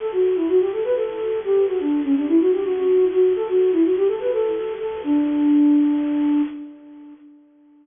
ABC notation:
X:1
M:7/8
L:1/16
Q:1/4=125
K:D
V:1 name="Flute"
A F2 E F G A B A4 G2 | F D2 C D E F G F4 F2 | A F2 E F G A B A4 A2 | D14 |]